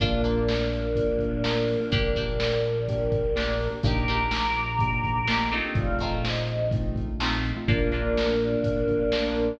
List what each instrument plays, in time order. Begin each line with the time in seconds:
0.00 synth bass 1 A#1, acoustic guitar (steel) A#3 D4 F4, acoustic grand piano A#3 D4 F4, choir aahs A#3 D4, kick, closed hi-hat
0.24 acoustic guitar (steel) A#3 D4 F4, closed hi-hat
0.48 snare
0.73 closed hi-hat
0.95 acoustic grand piano A#3 D4 F4, kick, closed hi-hat
1.19 kick, closed hi-hat
1.43 acoustic grand piano A#3 D4 F4, acoustic guitar (steel) A#3 D4 F4, snare
1.68 open hi-hat
1.80 acoustic grand piano A#3 D4 F4
1.91 synth bass 1 A#1, acoustic grand piano A#3 D4 G4, acoustic guitar (steel) A#3 D4 G4, choir aahs A#4 D5, kick, closed hi-hat
2.16 acoustic guitar (steel) A#3 D4 G4, kick, closed hi-hat
2.40 snare
2.64 closed hi-hat
2.88 acoustic grand piano A#3 D4 G4, kick, closed hi-hat
3.12 kick, closed hi-hat
3.35 acoustic grand piano A#3 D4 G4, acoustic guitar (steel) A#3 D4 G4, snare
3.60 open hi-hat
3.70 acoustic grand piano A#3 D4 G4
3.83 synth bass 1 A#1, acoustic grand piano A#3 D4 D#4 G4, acoustic guitar (steel) A#3 D4 D#4 G4, choir aahs A#5 D6, kick, closed hi-hat
4.08 acoustic guitar (steel) A#3 D4 D#4 G4, closed hi-hat
4.31 snare
4.54 closed hi-hat
4.79 acoustic grand piano A#3 D4 D#4 G4, kick, closed hi-hat
5.04 kick, closed hi-hat
5.28 acoustic grand piano A#3 D4 D#4 G4, acoustic guitar (steel) A#3 D4 D#4 G4, snare
5.51 acoustic guitar (steel) A3 C4 D#4 F4, closed hi-hat
5.65 acoustic grand piano A#3 D4 D#4 G4
5.75 synth bass 1 A#1, acoustic grand piano A3 C4 D#4 F4, choir aahs D5 F5, kick, closed hi-hat
5.99 acoustic guitar (steel) A3 C4 D#4, kick, closed hi-hat
6.03 acoustic guitar (steel) F4
6.23 choir aahs C5 D#5, snare
6.48 closed hi-hat
6.71 acoustic grand piano A3 C4 D#4 F4, kick, closed hi-hat
6.96 kick, closed hi-hat
7.20 acoustic guitar (steel) A3 C4 D#4 F4, acoustic grand piano A3 C4 D#4 F4, snare
7.44 closed hi-hat
7.56 acoustic grand piano A3 C4 D#4 F4
7.67 synth bass 1 A#1, choir aahs A#3 D4, acoustic grand piano A#3 D4 F4, acoustic guitar (steel) A#3 D4 F4, kick, closed hi-hat
7.81 acoustic grand piano A#3 D4 F4
7.91 acoustic grand piano A#3 D4 F4, acoustic guitar (steel) A#3 D4 F4, closed hi-hat
8.03 acoustic grand piano A#3 D4 F4
8.18 snare
8.27 acoustic grand piano A#3 D4 F4
8.41 closed hi-hat
8.64 synth bass 1 A#1, kick, closed hi-hat
8.76 acoustic grand piano A#3 D4 F4
8.88 acoustic grand piano A#3 D4 F4, kick, closed hi-hat
8.99 acoustic grand piano A#3 D4 F4
9.12 acoustic guitar (steel) A#3 D4 F4, snare
9.36 closed hi-hat